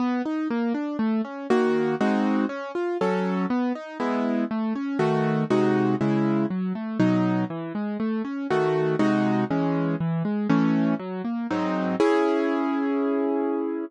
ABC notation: X:1
M:4/4
L:1/8
Q:1/4=120
K:C#m
V:1 name="Acoustic Grand Piano"
B, D ^A, =D =A, C [^D,^A,F]2 | [G,^B,DF]2 C ^E [F,CA]2 =B, D | [G,B,E]2 A, C [D,A,F]2 [^B,,G,DF]2 | [C,G,E]2 F, A, [B,,F,D]2 E, G, |
A, C [D,A,F]2 [^B,,G,DF]2 [E,G,C]2 | E, G, [E,A,C]2 F, ^A, [G,,F,^B,D]2 | [CEG]8 |]